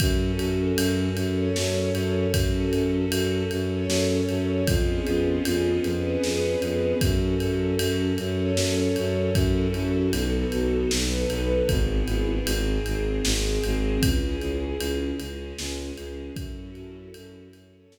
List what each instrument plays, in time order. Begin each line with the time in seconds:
0.00 violin F#2, string ensemble 1 C#4 F#4 A4, kick, ride
0.39 violin F#2, ride
0.76 violin F#2, ride
1.16 violin F#2, string ensemble 1 C#4 A4 C#5, ride
1.56 violin F#2, snare
1.93 violin F#2, ride
2.32 violin F#2, string ensemble 1 C#4 F#4 A4, kick, ride
2.72 violin F#2, ride
3.10 violin F#2, ride
3.51 violin F#2, string ensemble 1 C#4 A4 C#5, ride
3.88 violin F#2, snare
4.29 violin F#2, ride
4.67 violin F2, string ensemble 1 B3 C#4 F4 G#4, kick, ride
5.07 violin F2, ride
5.45 violin F2, ride
5.84 violin F2, string ensemble 1 B3 C#4 G#4 B4, ride
6.23 violin F2, snare
6.61 violin F2, ride
7.01 violin F#2, string ensemble 1 C#4 F#4 A4, kick, ride
7.40 violin F#2, ride
7.79 violin F#2, ride
8.18 violin F#2, string ensemble 1 C#4 A4 C#5, ride
8.56 violin F#2, snare
8.96 violin F#2, ride
9.34 violin F#2, string ensemble 1 C#4 E4 F#4 A4, kick, ride
9.74 violin F#2, ride
10.12 violin B1, string ensemble 1 B3 D#4 F#4 A4, ride
10.52 violin B1, ride
10.91 violin B1, string ensemble 1 B3 D#4 A4 B4, snare
11.29 violin B1, ride
11.69 violin G#1, string ensemble 1 B3 E4 G#4, kick, ride
12.06 violin G#1, ride
12.46 violin G#1, string ensemble 1 C4 D#4 G#4, ride
12.86 violin G#1, ride
13.24 violin G#1, string ensemble 1 G#3 C4 G#4, snare
13.64 violin G#1, ride
14.02 violin C#2, string ensemble 1 C#4 E4 G#4, kick, ride
14.42 violin C#2, ride
14.79 violin C#2, ride
15.20 violin C#2, string ensemble 1 G#3 C#4 G#4, ride
15.58 violin C#2, snare
15.97 violin C#2, ride
16.36 violin F#2, string ensemble 1 C#4 E4 F#4 A4, kick, ride
16.75 violin F#2, ride
17.14 violin F#2, ride
17.53 violin F#2, string ensemble 1 C#4 E4 A4 C#5, ride
17.92 violin F#2, snare